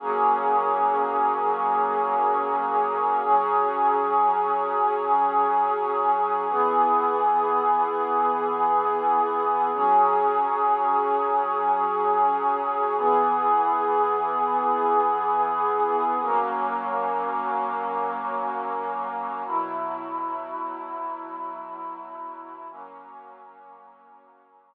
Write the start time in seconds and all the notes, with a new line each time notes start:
0.00 F#3 A#3 C#4 G#4
3.24 F#3 C#4 G#4
6.49 E3 B3 G#4
9.74 F#3 C#4 G#4
12.97 E3 B3 G#4
16.21 F#3 A#3 C#4
19.46 B2 F#3 E4
22.70 F#3 A#3 C#4